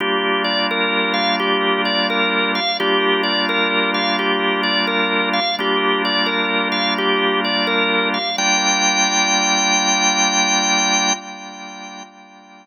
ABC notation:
X:1
M:4/4
L:1/8
Q:"Swing" 1/4=86
K:Gm
V:1 name="Drawbar Organ"
G d B f G d B f | G d B f G d B f | G d B f G d B f | g8 |]
V:2 name="Drawbar Organ"
[G,B,DF]8 | [G,B,DF]8 | [G,B,DF]8 | [G,B,DF]8 |]